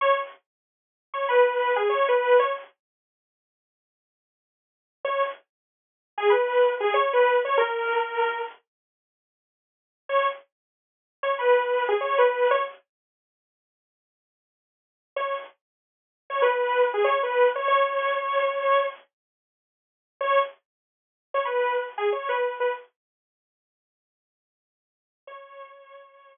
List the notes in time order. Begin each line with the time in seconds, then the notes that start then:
0.01 C#5
1.14 C#5
1.29 B4
1.76 G#4
1.89 C#5
2.08 B4
2.39 C#5
5.04 C#5
6.18 G#4
6.30 B4
6.80 G#4
6.94 C#5
7.13 B4
7.45 C#5
7.58 A#4
10.09 C#5
11.23 C#5
11.39 B4
11.89 G#4
12.01 C#5
12.18 B4
12.51 C#5
15.16 C#5
16.30 C#5
16.42 B4
16.94 G#4
17.04 C#5
17.23 B4
17.56 C#5
17.68 C#5
20.21 C#5
21.34 C#5
21.45 B4
21.98 G#4
22.13 C#5
22.29 B4
22.60 B4
25.27 C#5